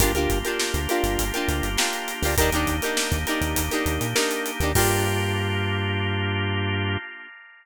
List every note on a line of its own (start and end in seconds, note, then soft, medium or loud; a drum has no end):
0.00 0.13 G1 medium
0.00 2.32 A#3 medium
0.00 2.32 D4 medium
0.00 0.12 D4 medium
0.00 2.32 F4 medium
0.00 0.12 F4 loud
0.00 2.32 G4 medium
0.00 0.12 G4 loud
0.00 0.12 A#4 medium
0.00 kick loud
0.00 closed hi-hat loud
0.14 0.28 D2 medium
0.14 0.39 D4 medium
0.14 0.39 F4 medium
0.14 0.39 G4 medium
0.14 0.39 A#4 medium
0.14 closed hi-hat medium
0.29 0.43 G1 medium
0.29 kick loud
0.29 closed hi-hat medium
0.45 0.81 D4 medium
0.45 0.81 F4 medium
0.45 0.81 G4 medium
0.45 0.81 A#4 medium
0.45 closed hi-hat medium
0.60 snare loud
0.74 0.87 D2 medium
0.74 closed hi-hat medium
0.89 1.25 D4 medium
0.89 1.25 F4 medium
0.89 1.25 G4 medium
0.89 1.25 A#4 medium
0.89 closed hi-hat medium
1.04 1.17 G1 medium
1.04 snare soft
1.04 closed hi-hat medium
1.19 1.32 G1 medium
1.19 kick medium
1.19 closed hi-hat medium
1.34 1.70 D4 medium
1.34 1.70 F4 medium
1.34 1.70 G4 medium
1.34 1.70 A#4 medium
1.34 closed hi-hat medium
1.48 1.62 D2 medium
1.48 snare soft
1.48 closed hi-hat medium
1.63 1.77 G1 medium
1.63 closed hi-hat medium
1.77 2.13 D4 medium
1.77 2.13 F4 medium
1.77 2.13 G4 medium
1.77 2.13 A#4 medium
1.77 snare loud
1.93 closed hi-hat medium
2.08 snare soft
2.08 closed hi-hat medium
2.22 2.36 D2 medium
2.22 2.35 D4 medium
2.22 2.35 F4 medium
2.22 2.35 G4 medium
2.22 2.35 A#4 medium
2.22 open hi-hat medium
2.37 2.51 D#2 medium
2.37 4.71 A#3 medium
2.37 4.71 D4 medium
2.37 4.71 D#4 medium
2.37 2.50 D#4 loud
2.37 4.71 G4 medium
2.37 2.50 G4 medium
2.37 2.50 A#4 medium
2.37 kick loud
2.37 closed hi-hat loud
2.41 2.50 D4 loud
2.52 2.66 D#2 medium
2.52 2.76 D4 medium
2.52 2.76 D#4 medium
2.52 2.76 G4 medium
2.52 2.76 A#4 medium
2.52 closed hi-hat medium
2.67 2.80 D#2 medium
2.67 kick medium
2.67 closed hi-hat medium
2.82 3.19 D4 medium
2.82 3.19 D#4 medium
2.82 3.19 G4 medium
2.82 3.19 A#4 medium
2.82 closed hi-hat medium
2.97 snare loud
3.12 3.25 D#2 medium
3.12 kick medium
3.12 closed hi-hat medium
3.27 3.63 D4 medium
3.27 3.63 D#4 medium
3.27 3.63 G4 medium
3.27 3.63 A#4 medium
3.27 closed hi-hat medium
3.41 3.55 D#2 medium
3.41 closed hi-hat medium
3.56 3.70 D#2 medium
3.56 kick medium
3.56 closed hi-hat loud
3.71 4.07 D4 medium
3.71 4.07 D#4 medium
3.71 4.07 G4 medium
3.71 4.07 A#4 medium
3.71 snare soft
3.71 closed hi-hat medium
3.86 3.99 D#2 medium
3.86 closed hi-hat medium
4.01 4.14 A#2 medium
4.01 closed hi-hat medium
4.15 4.51 D4 medium
4.15 4.51 D#4 medium
4.15 4.51 G4 medium
4.15 4.51 A#4 medium
4.15 snare loud
4.31 closed hi-hat medium
4.46 closed hi-hat medium
4.60 4.74 D#2 medium
4.60 4.72 D4 medium
4.60 4.72 D#4 medium
4.60 4.72 G4 medium
4.60 4.72 A#4 medium
4.60 closed hi-hat medium
4.75 6.97 G2 loud
4.75 6.97 A#3 loud
4.75 6.97 D4 loud
4.75 6.97 D4 medium
4.75 6.97 F4 loud
4.75 6.97 G4 medium
4.75 6.97 G4 loud
4.75 6.97 A#4 medium
4.75 kick loud
4.75 crash loud